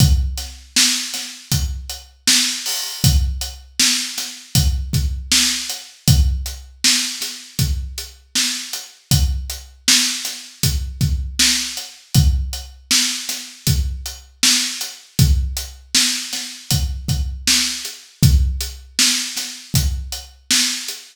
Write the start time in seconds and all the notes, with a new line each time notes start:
0.00 kick, closed hi-hat
0.38 snare, closed hi-hat
0.76 snare
1.14 snare, closed hi-hat
1.52 kick, closed hi-hat
1.90 closed hi-hat
2.27 snare
2.66 open hi-hat
3.04 kick, closed hi-hat
3.41 closed hi-hat
3.80 snare
4.18 snare, closed hi-hat
4.55 kick, closed hi-hat
4.93 kick, closed hi-hat
5.32 snare
5.69 closed hi-hat
6.08 kick, closed hi-hat
6.46 closed hi-hat
6.84 snare
7.21 snare, closed hi-hat
7.59 kick, closed hi-hat
7.98 closed hi-hat
8.35 snare
8.73 closed hi-hat
9.11 kick, closed hi-hat
9.50 closed hi-hat
9.88 snare
10.25 snare, closed hi-hat
10.63 kick, closed hi-hat
11.01 kick, closed hi-hat
11.39 snare
11.77 closed hi-hat
12.15 kick, closed hi-hat
12.53 closed hi-hat
12.91 snare
13.29 snare, closed hi-hat
13.67 kick, closed hi-hat
14.06 closed hi-hat
14.43 snare
14.81 closed hi-hat
15.19 kick, closed hi-hat
15.57 closed hi-hat
15.95 snare
16.33 snare, closed hi-hat
16.71 kick, closed hi-hat
17.08 kick, closed hi-hat
17.47 snare
17.85 closed hi-hat
18.23 kick, closed hi-hat
18.61 closed hi-hat
18.99 snare
19.37 snare, closed hi-hat
19.74 kick, closed hi-hat
20.12 closed hi-hat
20.51 snare
20.88 closed hi-hat